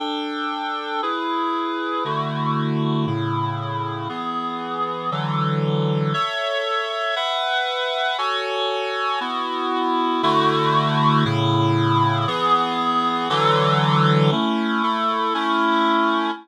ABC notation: X:1
M:3/4
L:1/8
Q:1/4=176
K:Dlyd
V:1 name="Clarinet"
[DA=g]6 | [EGB]6 | [D,A,EF]6 | [A,,C,E]6 |
[E,B,G]6 | [D,E,F,A]6 | [K:Alyd] [Ace]6 | [Bef]6 |
[FAcg]6 | [B,EF]6 | [K:Dlyd] [D,A,EF]6 | [A,,C,E]6 |
[E,B,G]6 | [D,E,F,A]6 | [K:Alyd] [A,CE]3 [A,EA]3 | [A,CE]6 |]